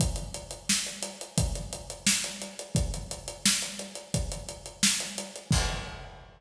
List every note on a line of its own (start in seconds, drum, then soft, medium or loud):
0.00 kick loud
0.00 closed hi-hat loud
0.16 closed hi-hat medium
0.34 closed hi-hat medium
0.51 closed hi-hat medium
0.69 snare loud
0.86 closed hi-hat medium
1.02 closed hi-hat loud
1.21 closed hi-hat medium
1.38 kick loud
1.38 closed hi-hat loud
1.55 closed hi-hat medium
1.73 closed hi-hat medium
1.90 closed hi-hat medium
2.07 snare loud
2.24 closed hi-hat medium
2.42 closed hi-hat medium
2.59 closed hi-hat medium
2.75 kick loud
2.75 closed hi-hat loud
2.94 closed hi-hat medium
3.11 closed hi-hat medium
3.28 closed hi-hat medium
3.46 snare loud
3.62 closed hi-hat medium
3.79 closed hi-hat medium
3.95 closed hi-hat medium
4.14 kick medium
4.14 closed hi-hat loud
4.32 closed hi-hat medium
4.49 closed hi-hat medium
4.66 closed hi-hat medium
4.83 snare loud
5.00 closed hi-hat medium
5.18 closed hi-hat medium
5.36 closed hi-hat medium
5.51 kick loud
5.51 crash loud